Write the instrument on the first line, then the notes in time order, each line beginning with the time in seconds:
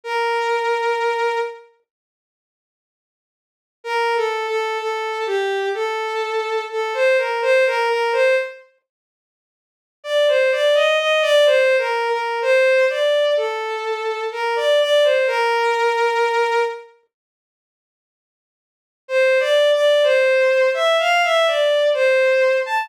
violin
0.04 A#4
3.84 A#4
4.16 A4
4.48 A4
4.79 A4
5.26 G4
5.74 A4
6.71 A4
6.94 C5
7.18 A#4
7.42 C5
7.66 A#4
7.89 A#4
8.12 C5
10.04 D5
10.28 C5
10.52 D5
10.75 D#5
10.99 D#5
11.22 D5
11.46 C5
11.78 A#4
12.09 A#4
12.42 C5
12.90 D5
13.37 A4
14.32 A#4
14.56 D5
14.81 D5
15.04 C5
15.27 A#4
19.08 C5
19.40 D5
19.72 D5
20.03 C5
20.74 E5
20.99 F5
21.24 E5
21.47 D5
21.94 C5
22.66 A5